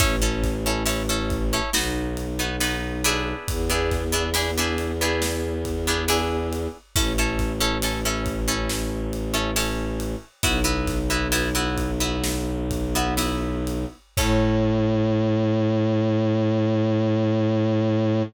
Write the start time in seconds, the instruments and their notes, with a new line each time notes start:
0.00 violin A1, acoustic guitar (steel) C#4 E4 A4, kick, ride
0.22 acoustic guitar (steel) C#4 E4 A4
0.43 kick, snare, ride
0.66 acoustic guitar (steel) C#4 E4 A4
0.86 acoustic guitar (steel) C#4 E4 A4, ride
1.09 acoustic guitar (steel) C#4 E4 A4
1.30 kick, ride
1.53 acoustic guitar (steel) C#4 E4 A4
1.73 violin B1, acoustic guitar (steel) B3 D#4 F#4, snare
2.17 ride
2.39 acoustic guitar (steel) B3 D#4 F#4
2.60 acoustic guitar (steel) B3 D#4 F#4, ride
3.04 acoustic guitar (steel) B3 D4 E4 G#4, ride
3.47 violin E2, kick, ride
3.70 acoustic guitar (steel) B3 D4 E4 G#4
3.91 kick, snare, ride
4.12 acoustic guitar (steel) B3 D4 E4 G#4
4.34 acoustic guitar (steel) B3 D4 E4 G#4, ride
4.58 acoustic guitar (steel) B3 D4 E4 G#4
4.78 ride
5.01 acoustic guitar (steel) B3 D4 E4 G#4
5.22 snare
5.65 kick, ride
5.87 acoustic guitar (steel) B3 D4 E4 G#4
6.08 acoustic guitar (steel) B3 D4 E4 G#4, ride
6.53 ride
6.96 violin A1, acoustic guitar (steel) C#4 E4 A4, kick, ride
7.18 acoustic guitar (steel) C#4 E4 A4
7.39 kick, snare, ride
7.60 acoustic guitar (steel) C#4 E4 A4
7.82 acoustic guitar (steel) C#4 E4 A4, ride
8.05 acoustic guitar (steel) C#4 E4 A4
8.26 kick, ride
8.48 acoustic guitar (steel) C#4 E4 A4
8.69 snare
9.13 ride
9.34 acoustic guitar (steel) C#4 E4 A4
9.56 acoustic guitar (steel) C#4 E4 A4, ride
10.00 ride
10.43 violin B1, acoustic guitar (steel) B3 E4 F#4, kick, ride
10.64 acoustic guitar (steel) B3 E4 F#4
10.87 kick, snare, ride
11.10 acoustic guitar (steel) B3 E4 F#4
11.32 acoustic guitar (steel) B3 E4 F#4, ride
11.55 acoustic guitar (steel) B3 E4 F#4
11.77 kick, ride
12.00 acoustic guitar (steel) B3 E4 F#4
12.24 snare
12.71 kick, ride
12.95 acoustic guitar (steel) B3 E4 F#4
13.17 acoustic guitar (steel) B3 E4 F#4, ride
13.67 ride
14.17 violin A2, acoustic guitar (steel) C#4 E4 A4, kick, crash